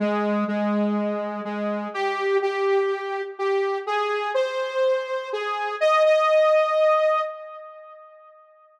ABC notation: X:1
M:4/4
L:1/8
Q:1/4=124
K:Ab
V:1 name="Lead 2 (sawtooth)"
A,2 A,4 A,2 | G2 G4 G2 | A2 c4 A2 | e e5 z2 |]